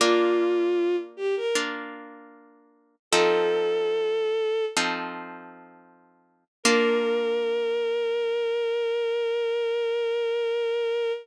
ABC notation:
X:1
M:4/4
L:1/16
Q:1/4=77
K:Bb
V:1 name="Violin"
F6 G B z8 | "^rit." A8 z8 | B16 |]
V:2 name="Orchestral Harp"
[B,DF]8 [B,DF]8 | "^rit." [F,CEA]8 [F,CEA]8 | [B,DF]16 |]